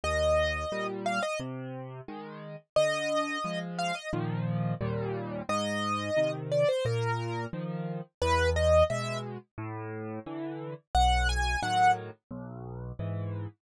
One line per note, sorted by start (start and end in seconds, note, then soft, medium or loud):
0.04 0.65 D#2 medium
0.04 0.87 D#5 medium
0.72 1.20 A#2 medium
0.72 1.20 G3 medium
1.06 1.22 F5 medium
1.23 1.39 D#5 medium
1.40 2.01 C3 medium
2.08 2.56 D#3 medium
2.08 2.56 G#3 medium
2.76 3.38 D3 medium
2.76 3.59 D#5 loud
3.44 3.92 F3 medium
3.44 3.92 G#3 medium
3.79 3.95 F5 medium
3.95 4.11 D#5 medium
4.13 4.74 A#2 medium
4.13 4.74 D#3 medium
4.13 4.74 F3 medium
4.81 5.42 D#2 loud
4.81 5.42 A#2 loud
4.81 5.42 G3 medium
5.49 6.10 G#2 medium
5.49 6.32 D#5 loud
6.17 6.64 C3 medium
6.17 6.64 D#3 medium
6.52 6.68 D5 medium
6.69 6.85 C5 medium
6.85 7.46 A#2 medium
6.85 7.45 A#4 medium
7.53 8.01 D#3 medium
7.53 8.01 F3 medium
8.22 8.83 E2 loud
8.22 8.50 B4 loud
8.56 8.84 D#5 medium
8.90 9.38 B2 medium
8.90 9.38 G#3 medium
8.90 9.18 E5 medium
9.58 10.19 A2 loud
10.26 10.74 D3 medium
10.26 10.74 E3 medium
10.95 11.56 B1 medium
10.95 11.28 F#5 loud
11.29 11.60 G#5 medium
11.62 12.10 A2 medium
11.62 12.10 D#3 medium
11.62 12.10 F#3 medium
11.62 11.91 F#5 medium
12.31 12.92 B1 loud
12.99 13.47 G#2 medium
12.99 13.47 E3 medium